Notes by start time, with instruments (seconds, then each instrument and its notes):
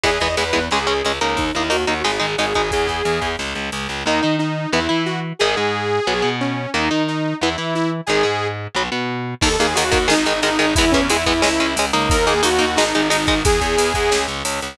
0.03 electric bass (finger) E2, overdriven guitar E3 G#3 B3, lead 2 (sawtooth) G#4, kick, ride
0.20 electric bass (finger) E2, overdriven guitar E3 G#3 B3, lead 2 (sawtooth) D#5, kick, ride
0.37 electric bass (finger) E2, overdriven guitar E3 G#3 B3, lead 2 (sawtooth) B4, ride
0.53 electric bass (finger) E2, overdriven guitar E3 G#3 B3, kick, ride
0.71 electric bass (finger) C#2, overdriven guitar G#3 C#4, lead 2 (sawtooth) G#4, snare
0.87 electric bass (finger) C#2, overdriven guitar G#3 C#4, ride
1.05 electric bass (finger) C#2, overdriven guitar G#3 C#4, ride
1.21 electric bass (finger) C#2, overdriven guitar A#3 D#4, ride
1.37 electric bass (finger) D#2, lead 2 (sawtooth) D#4, kick, ride
1.55 electric bass (finger) D#2, overdriven guitar A#3 D#4, lead 2 (sawtooth) E4, ride
1.70 electric bass (finger) D#2, overdriven guitar A#3 D#4, lead 2 (sawtooth) F#4, ride
1.87 electric bass (finger) D#2, overdriven guitar A#3 D#4, ride
2.04 electric bass (finger) G#1, overdriven guitar G#3 D#4, lead 2 (sawtooth) G#4, snare
2.20 electric bass (finger) G#1, overdriven guitar G#3 D#4, ride
2.38 electric bass (finger) G#1, overdriven guitar G#3 D#4, lead 2 (sawtooth) G#4, ride
2.54 electric bass (finger) G#1, overdriven guitar G#3 D#4, kick, ride
2.71 electric bass (finger) E2, lead 2 (sawtooth) G#4, kick, ride
2.87 electric bass (finger) E2, kick, ride
3.05 electric bass (finger) E2, ride
3.22 electric bass (finger) E2, kick, ride
3.39 electric bass (finger) C#2, snare
3.55 electric bass (finger) C#2, ride
3.72 electric bass (finger) C#2, ride
3.89 electric bass (finger) C#2, ride
4.06 electric bass (finger) D#2, overdriven guitar D#3 A#3, lead 2 (sawtooth) D#4
4.23 electric bass (finger) D#3, overdriven guitar D#4
4.39 lead 2 (sawtooth) D#4
4.72 electric bass (finger) E2, overdriven guitar E3 B3, lead 2 (sawtooth) E4
4.89 electric bass (finger) E3, overdriven guitar E4
5.06 lead 2 (sawtooth) F#4
5.39 electric bass (finger) G#1, overdriven guitar D#3 G#3, lead 2 (sawtooth) G#4
5.57 electric bass (finger) G#2, overdriven guitar G#3
6.07 electric bass (finger) B1, overdriven guitar F#3 B3
6.22 electric bass (finger) B2, overdriven guitar B3
6.41 lead 2 (sawtooth) C#4
6.74 electric bass (finger) D#2, overdriven guitar D#3 A#3, lead 2 (sawtooth) D#4
6.91 electric bass (finger) D#3, overdriven guitar D#4
7.08 lead 2 (sawtooth) D#4
7.41 electric bass (finger) E2, overdriven guitar E3 B3, lead 2 (sawtooth) E4
7.58 electric bass (finger) E3, overdriven guitar E4
7.75 lead 2 (sawtooth) E4
8.06 electric bass (finger) G#1, overdriven guitar D#3 G#3, lead 2 (sawtooth) G#4
8.23 electric bass (finger) G#2, overdriven guitar G#3
8.75 electric bass (finger) B1, overdriven guitar F#3 B3
8.92 electric bass (finger) B2, overdriven guitar B3
9.41 electric bass (finger) D#2, overdriven guitar D#3 A#3, lead 2 (sawtooth) A4, kick, crash
9.59 electric bass (finger) D#2, overdriven guitar D#3 A#3, lead 2 (sawtooth) G#4, ride
9.75 electric bass (finger) D#2, overdriven guitar D#3 A#3, lead 2 (sawtooth) F#4, ride
9.92 electric bass (finger) D#2, overdriven guitar D#3 A#3, kick, ride
10.08 electric bass (finger) G#1, overdriven guitar D#3 G#3, lead 2 (sawtooth) D#4, snare
10.26 electric bass (finger) G#1, overdriven guitar D#3 G#3, ride
10.42 electric bass (finger) G#1, overdriven guitar D#3 G#3, lead 2 (sawtooth) D#4, ride
10.59 electric bass (finger) G#1, overdriven guitar D#3 G#3, ride
10.76 electric bass (finger) E2, overdriven guitar E3 G#3 B3, lead 2 (sawtooth) E4, kick, ride
10.91 electric bass (finger) E2, overdriven guitar E3 G#3 B3, lead 2 (sawtooth) C#4, kick, ride
11.09 electric bass (finger) E2, overdriven guitar E3 G#3 B3, lead 2 (sawtooth) E4, ride
11.26 electric bass (finger) E2, overdriven guitar E3 G#3 B3, kick, ride
11.42 electric bass (finger) C#2, overdriven guitar G#3 C#4, lead 2 (sawtooth) E4, snare
11.60 electric bass (finger) C#2, overdriven guitar G#3 C#4, ride
11.76 electric bass (finger) C#2, overdriven guitar G#3 C#4, ride
11.93 electric bass (finger) C#2, overdriven guitar A#3 D#4, ride
12.10 electric bass (finger) D#2, lead 2 (sawtooth) A#4, kick, ride
12.27 electric bass (finger) D#2, overdriven guitar A#3 D#4, lead 2 (sawtooth) G#4, ride
12.43 electric bass (finger) D#2, overdriven guitar A#3 D#4, lead 2 (sawtooth) F#4, ride
12.59 electric bass (finger) D#2, overdriven guitar A#3 D#4, ride
12.76 electric bass (finger) G#1, overdriven guitar G#3 D#4, lead 2 (sawtooth) D#4, snare
12.95 electric bass (finger) G#1, overdriven guitar G#3 D#4, ride
13.10 electric bass (finger) G#1, overdriven guitar G#3 D#4, lead 2 (sawtooth) D#4, ride
13.27 electric bass (finger) G#1, overdriven guitar G#3 D#4, kick, ride
13.45 electric bass (finger) E2, lead 2 (sawtooth) G#4, kick, ride
13.61 electric bass (finger) E2, kick, ride
13.77 electric bass (finger) E2, ride
13.94 electric bass (finger) E2, kick, ride
14.11 electric bass (finger) C#2, snare
14.28 electric bass (finger) C#2, ride
14.45 electric bass (finger) C#2, ride
14.62 electric bass (finger) C#2, ride